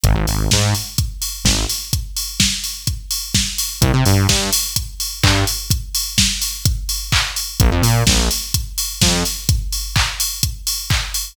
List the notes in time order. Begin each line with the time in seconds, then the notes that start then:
0.04 G#1, kick, closed hi-hat
0.15 G#1
0.27 G#1, open hi-hat
0.51 G#2, kick, snare
0.75 open hi-hat
0.98 kick, closed hi-hat
1.22 open hi-hat
1.44 G#1, kick, snare
1.69 open hi-hat
1.93 kick, closed hi-hat
2.17 open hi-hat
2.40 kick, snare
2.64 open hi-hat
2.87 kick, closed hi-hat
3.11 open hi-hat
3.35 kick, snare
3.58 open hi-hat
3.81 C2, kick, closed hi-hat
3.94 C3
4.06 G2, open hi-hat
4.29 G2, kick, snare
4.53 open hi-hat
4.76 kick, closed hi-hat
5.00 open hi-hat
5.23 G2, kick, clap
5.47 open hi-hat
5.70 kick, closed hi-hat
5.95 open hi-hat
6.18 kick, snare
6.42 open hi-hat
6.65 kick, closed hi-hat
6.89 open hi-hat
7.12 kick, clap
7.36 open hi-hat
7.60 A#1, kick, closed hi-hat
7.71 F2
7.82 A#2, open hi-hat
8.07 A#1, kick, snare
8.31 open hi-hat
8.54 kick, closed hi-hat
8.78 open hi-hat
9.01 F2, kick, snare
9.25 open hi-hat
9.49 kick, closed hi-hat
9.72 open hi-hat
9.96 kick, clap
10.20 open hi-hat
10.43 kick, closed hi-hat
10.67 open hi-hat
10.90 kick, clap
11.14 open hi-hat